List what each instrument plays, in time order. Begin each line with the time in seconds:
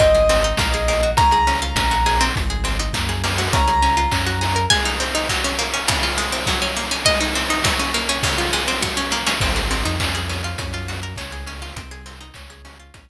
0.00 synth bass 2 G#1, pizzicato strings C4, acoustic grand piano D#5, kick, closed hi-hat
0.15 pizzicato strings G#4, closed hi-hat
0.29 pizzicato strings C4, open hi-hat
0.44 pizzicato strings D#4, closed hi-hat
0.57 synth bass 2 A#1, pizzicato strings A#3, kick, snare
0.72 pizzicato strings G#4, closed hi-hat
0.88 pizzicato strings A#3, open hi-hat
1.03 pizzicato strings F#4, closed hi-hat
1.17 synth bass 2 C#2, pizzicato strings C#4, acoustic grand piano A#5, kick, closed hi-hat
1.31 pizzicato strings G#4, closed hi-hat
1.47 pizzicato strings C#4, open hi-hat
1.62 pizzicato strings F4, closed hi-hat
1.75 synth bass 2 A#1, pizzicato strings C#4, kick, snare
1.91 pizzicato strings F#4, closed hi-hat
2.06 pizzicato strings G#4, open hi-hat
2.20 pizzicato strings C4, open hi-hat
2.36 synth bass 2 G#1, kick, closed hi-hat
2.50 pizzicato strings G#4, closed hi-hat
2.64 pizzicato strings C4, open hi-hat
2.79 pizzicato strings D#4, closed hi-hat
2.93 synth bass 2 F#2, pizzicato strings A#3, kick, clap
3.09 pizzicato strings G#4, closed hi-hat
3.24 pizzicato strings A#3, open hi-hat
3.37 pizzicato strings F#4, open hi-hat
3.53 synth bass 2 C#2, pizzicato strings C#4, acoustic grand piano A#5, kick, closed hi-hat
3.67 pizzicato strings G#4, closed hi-hat
3.82 pizzicato strings C#4, open hi-hat
3.97 pizzicato strings F4, closed hi-hat
4.11 synth bass 2 F#2, pizzicato strings C#4, kick, clap
4.26 pizzicato strings F#4, closed hi-hat
4.41 pizzicato strings G#4, open hi-hat
4.56 pizzicato strings A#4, closed hi-hat
4.70 pizzicato strings G#3, harpsichord G#5, kick, crash
4.85 pizzicato strings D#4, ride
5.00 pizzicato strings C4, ride
5.15 pizzicato strings D#4, ride
5.29 pizzicato strings F#3, kick, clap
5.44 pizzicato strings C#4, ride
5.59 pizzicato strings A#3, ride
5.74 pizzicato strings C#4, ride
5.88 pizzicato strings C#3, kick, ride
6.03 pizzicato strings F4, ride
6.16 pizzicato strings G#3, ride
6.32 pizzicato strings C4, ride
6.46 pizzicato strings F#3, kick, snare
6.62 pizzicato strings C#4, ride
6.76 pizzicato strings A#3, ride
6.91 pizzicato strings C#4, ride
7.05 pizzicato strings G#3, harpsichord D#5, kick, ride
7.20 pizzicato strings D#4, ride
7.35 pizzicato strings C4, ride
7.49 pizzicato strings D#4, ride
7.64 pizzicato strings F#3, kick, snare
7.79 pizzicato strings C#4, ride
7.94 pizzicato strings A#3, ride
8.07 pizzicato strings C#4, ride
8.23 pizzicato strings C#3, kick, ride
8.38 pizzicato strings F4, ride
8.53 pizzicato strings G#3, ride
8.67 pizzicato strings C4, ride
8.81 pizzicato strings F#3, kick, snare
8.97 pizzicato strings C#4
9.11 pizzicato strings A#3, snare
9.26 pizzicato strings C#4, snare
9.40 synth bass 2 G#1, pizzicato strings C4, kick, crash
9.56 pizzicato strings G#4, closed hi-hat
9.71 pizzicato strings C4, open hi-hat
9.85 synth bass 2 F2, pizzicato strings D#4, closed hi-hat
10.00 pizzicato strings C#4, kick, clap
10.14 pizzicato strings G#4, closed hi-hat
10.29 pizzicato strings C#4, open hi-hat
10.43 pizzicato strings F4, closed hi-hat
10.58 synth bass 2 F#2, pizzicato strings C#4, kick, closed hi-hat
10.73 pizzicato strings F4, closed hi-hat
10.88 pizzicato strings F#4, open hi-hat
11.01 pizzicato strings A#4, closed hi-hat
11.16 synth bass 2 C#2, pizzicato strings C#4, kick, clap
11.31 pizzicato strings G#4, closed hi-hat
11.46 pizzicato strings C#4, open hi-hat
11.62 pizzicato strings F4, open hi-hat
11.76 synth bass 2 C2, pizzicato strings C4, kick, closed hi-hat
11.91 pizzicato strings G#4, closed hi-hat
12.06 pizzicato strings C4, open hi-hat
12.20 pizzicato strings D#4, closed hi-hat
12.34 synth bass 2 C#2, pizzicato strings C#4, kick, clap
12.50 pizzicato strings G#4, closed hi-hat
12.65 pizzicato strings C#4, open hi-hat
12.79 pizzicato strings F4, closed hi-hat
12.94 synth bass 2 A#1, pizzicato strings C#4, kick, closed hi-hat
13.08 closed hi-hat